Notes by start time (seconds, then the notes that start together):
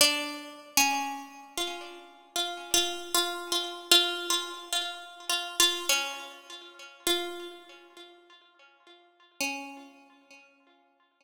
0.01 D4
0.77 C#4
1.57 F4
2.36 F4
2.74 F4
3.14 F4
3.52 F4
3.91 F4
4.30 F4
4.73 F4
5.29 F4
5.60 F4
5.89 C#4
7.07 F4
9.40 C#4